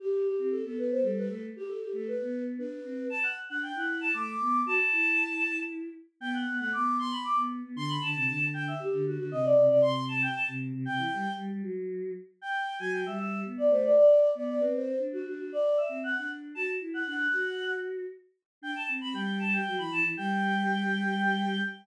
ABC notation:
X:1
M:3/4
L:1/16
Q:1/4=116
K:G
V:1 name="Choir Aahs"
G2 G G A A B c A B A z | G A G A B3 z B4 | a f z f g f2 a d'4 | a8 z4 |
g f2 f d'2 c' b d' z3 | c' b a4 g e G2 F F | _e d2 d c'2 a g a z3 | g4 z8 |
g3 _a g e e2 z d c d | d3 d d B c2 z F F F | d2 e2 f f z2 a z2 f | f6 z6 |
g a z b g2 a g2 b a z | g12 |]
V:2 name="Choir Aahs"
z3 C2 B,3 G,2 A,2 | z3 A,2 B,3 D2 C2 | z3 D2 E3 A,2 B,2 | F z E8 z2 |
B,2 B, A, B,4 z B,2 B, | D,2 D, C, D,4 z D,2 D, | C,2 C, C, C,4 z C,2 C, | C, E, G, z G, G, F,4 z2 |
z3 F,2 G,3 B,2 A,2 | z3 B,2 C3 D2 D2 | z3 C2 D3 F2 E2 | D2 F6 z4 |
D z C C G,4 F, E, E, E, | G,12 |]